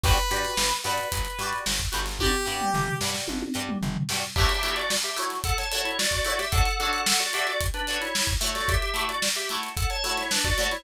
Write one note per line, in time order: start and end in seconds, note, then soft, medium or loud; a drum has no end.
0.03 0.19 G1 loud
0.03 0.13 F#4 medium
0.03 0.13 G4 medium
0.03 0.73 B4 loud
0.03 0.13 B4 medium
0.03 0.13 D5 medium
0.03 kick loud
0.03 open hi-hat medium
0.18 closed hi-hat medium
0.31 0.46 G2 medium
0.31 0.49 F#4 medium
0.31 0.49 G4 medium
0.31 0.49 B4 medium
0.31 0.49 D5 medium
0.31 closed hi-hat medium
0.45 closed hi-hat medium
0.57 0.72 G1 medium
0.57 snare loud
0.71 closed hi-hat medium
0.84 1.00 G2 medium
0.84 1.03 F#4 medium
0.84 1.03 G4 medium
0.84 1.57 B4 medium
0.84 1.03 B4 medium
0.84 1.03 D5 medium
0.84 closed hi-hat medium
0.98 closed hi-hat medium
1.12 1.27 G1 medium
1.12 kick medium
1.12 closed hi-hat loud
1.25 closed hi-hat medium
1.39 1.53 G2 medium
1.39 1.59 F#4 medium
1.39 1.59 G4 medium
1.39 1.59 B4 medium
1.39 snare soft
1.39 closed hi-hat medium
1.43 1.59 D5 medium
1.53 closed hi-hat medium
1.66 1.82 G1 medium
1.66 snare loud
1.80 kick medium
1.80 closed hi-hat medium
1.92 2.36 G1 loud
1.92 2.01 F#4 medium
1.92 2.01 G4 medium
1.92 2.01 B4 medium
1.92 2.01 D5 medium
1.92 closed hi-hat loud
2.06 snare medium
2.06 closed hi-hat medium
2.19 2.30 F#4 medium
2.19 2.94 G4 loud
2.19 2.30 G4 medium
2.19 2.30 B4 medium
2.19 2.30 D5 medium
2.19 kick medium
2.19 high tom loud
2.45 2.62 G2 medium
2.45 2.64 F#4 medium
2.45 2.64 G4 medium
2.45 2.64 B4 medium
2.45 2.64 D5 medium
2.61 mid tom medium
2.74 2.89 G1 medium
2.74 floor tom loud
2.88 floor tom medium
3.01 3.16 G2 medium
3.01 3.21 F#4 medium
3.01 3.21 G4 medium
3.01 3.21 B4 medium
3.01 snare loud
3.05 3.21 D5 medium
3.14 snare medium
3.28 3.44 G1 medium
3.28 high tom loud
3.42 high tom loud
3.54 3.70 G2 medium
3.54 3.73 F#4 medium
3.54 3.73 G4 medium
3.54 3.73 B4 medium
3.54 3.73 D5 medium
3.69 mid tom loud
3.82 3.97 G1 medium
3.82 floor tom loud
3.96 floor tom loud
4.09 4.25 G2 medium
4.09 4.20 F#4 medium
4.09 4.20 G4 medium
4.09 4.20 B4 medium
4.09 snare loud
4.13 4.20 D5 medium
4.36 4.47 A3 medium
4.36 4.47 E4 medium
4.36 4.47 F#4 medium
4.36 4.74 G4 loud
4.36 4.74 E5 loud
4.36 kick loud
4.36 crash loud
4.41 4.47 C#5 medium
4.49 closed hi-hat medium
4.63 4.82 A3 medium
4.63 4.82 E4 medium
4.63 4.82 F#4 medium
4.63 4.82 C#5 medium
4.63 closed hi-hat loud
4.76 4.89 F#4 loud
4.76 4.89 D5 loud
4.76 closed hi-hat medium
4.90 snare loud
5.03 5.17 G4 medium
5.03 5.17 E5 loud
5.03 closed hi-hat medium
5.16 5.35 A3 medium
5.16 5.35 E4 medium
5.16 5.35 F#4 medium
5.16 5.35 C#5 medium
5.16 closed hi-hat medium
5.30 snare soft
5.30 closed hi-hat medium
5.44 5.57 A4 loud
5.44 5.57 F#5 loud
5.44 kick loud
5.44 closed hi-hat loud
5.58 5.71 C#5 medium
5.58 5.71 A5 loud
5.58 snare soft
5.58 closed hi-hat medium
5.71 5.91 A3 medium
5.71 5.91 E4 medium
5.71 5.91 F#4 medium
5.71 5.84 C#5 medium
5.71 5.84 A5 loud
5.71 closed hi-hat loud
5.75 5.91 C#5 medium
5.85 5.98 E4 loud
5.85 5.98 C#5 loud
5.85 closed hi-hat medium
5.99 6.11 F#4 medium
5.99 6.11 D5 loud
5.99 snare loud
6.11 6.24 F#4 loud
6.11 6.24 D5 loud
6.11 kick medium
6.11 closed hi-hat medium
6.25 6.34 A3 medium
6.25 6.34 E4 medium
6.25 6.38 F#4 medium
6.25 6.34 F#4 medium
6.25 6.34 C#5 medium
6.25 6.38 D5 loud
6.25 snare soft
6.25 closed hi-hat medium
6.39 6.52 G4 loud
6.39 6.52 E5 loud
6.39 snare medium
6.39 closed hi-hat medium
6.52 6.62 D4 medium
6.52 6.62 F#4 medium
6.52 6.78 A4 loud
6.52 6.62 A4 medium
6.52 6.62 C#5 medium
6.52 6.78 F#5 loud
6.52 kick loud
6.52 closed hi-hat loud
6.65 closed hi-hat medium
6.79 6.99 D4 medium
6.79 6.99 F#4 medium
6.79 7.01 A4 loud
6.79 6.99 A4 medium
6.79 6.99 C#5 medium
6.79 7.01 F#5 loud
6.79 closed hi-hat medium
6.93 closed hi-hat medium
7.06 7.19 A4 medium
7.06 7.19 F#5 loud
7.06 snare loud
7.20 7.32 F#4 medium
7.20 7.32 D5 loud
7.20 closed hi-hat medium
7.33 7.53 D4 medium
7.33 7.53 F#4 medium
7.33 7.47 G4 loud
7.33 7.53 A4 medium
7.33 7.53 C#5 medium
7.33 7.47 E5 loud
7.33 closed hi-hat loud
7.47 7.60 F#4 medium
7.47 7.60 D5 loud
7.47 closed hi-hat medium
7.61 kick loud
7.61 closed hi-hat loud
7.74 7.99 D4 loud
7.74 7.99 B4 loud
7.74 closed hi-hat medium
7.87 8.07 D4 medium
7.87 8.07 F#4 medium
7.87 8.07 A4 medium
7.87 8.07 C#5 medium
7.87 snare soft
7.87 closed hi-hat medium
8.01 8.27 E4 medium
8.01 8.27 C#5 loud
8.01 snare soft
8.01 closed hi-hat medium
8.15 snare loud
8.27 kick loud
8.27 closed hi-hat medium
8.41 8.77 A3 loud
8.41 8.77 E4 medium
8.41 8.77 F#4 medium
8.41 8.77 C#5 medium
8.41 closed hi-hat medium
8.55 8.68 F#4 loud
8.55 8.68 D5 loud
8.55 snare medium
8.55 closed hi-hat medium
8.68 9.04 G4 loud
8.68 9.04 E5 loud
8.68 kick loud
8.68 closed hi-hat loud
8.82 closed hi-hat medium
8.94 9.13 A3 medium
8.94 9.13 E4 medium
8.94 9.13 F#4 medium
8.94 9.13 C#5 medium
8.94 closed hi-hat loud
9.09 9.22 F#4 medium
9.09 9.22 D5 loud
9.09 closed hi-hat medium
9.22 snare loud
9.35 9.49 G4 medium
9.35 9.49 E5 loud
9.35 closed hi-hat medium
9.49 9.69 A3 medium
9.49 9.69 E4 medium
9.49 9.69 F#4 medium
9.49 9.69 C#5 medium
9.49 closed hi-hat medium
9.63 closed hi-hat medium
9.77 9.89 A4 medium
9.77 9.89 F#5 medium
9.77 kick loud
9.77 closed hi-hat loud
9.90 10.03 C#5 loud
9.90 10.03 A5 loud
9.90 closed hi-hat medium
10.03 10.23 A3 medium
10.03 10.23 E4 medium
10.03 10.23 F#4 medium
10.03 10.16 C#5 loud
10.03 10.23 C#5 medium
10.03 10.16 A5 loud
10.03 closed hi-hat loud
10.17 10.30 E4 medium
10.17 10.30 C#5 loud
10.17 snare medium
10.17 closed hi-hat medium
10.31 10.44 D4 medium
10.31 10.44 B4 loud
10.31 snare loud
10.44 10.57 F#4 loud
10.44 10.57 D5 loud
10.44 kick loud
10.44 snare soft
10.44 closed hi-hat medium
10.58 10.67 A3 medium
10.58 10.67 E4 medium
10.58 10.70 F#4 medium
10.58 10.67 F#4 medium
10.58 10.67 C#5 medium
10.58 10.70 D5 loud
10.58 closed hi-hat medium
10.71 10.84 E4 loud
10.71 10.84 C#5 loud
10.71 snare medium
10.71 closed hi-hat medium